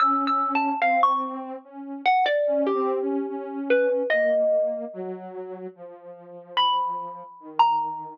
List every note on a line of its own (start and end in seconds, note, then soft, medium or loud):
0.00 0.74 C#4 loud
0.00 0.24 E6 medium
0.27 0.52 E6 medium
0.55 0.80 A5 medium
0.82 1.56 C4 loud
0.82 1.00 F5 medium
1.03 1.40 C#6 medium
1.64 2.01 C#4 medium
2.06 2.24 F#5 medium
2.26 2.63 D5 medium
2.47 2.71 C#4 loud
2.67 3.59 G4 medium
2.74 2.99 C4 loud
3.01 3.26 C#4 medium
3.29 4.03 C#4 medium
3.70 4.07 B4 medium
4.10 4.85 A#3 medium
4.10 5.21 D#5 medium
4.93 5.67 F#3 loud
5.75 7.23 F3 medium
6.57 7.49 B5 loud
7.40 8.14 D#3 medium
7.59 8.15 A#5 medium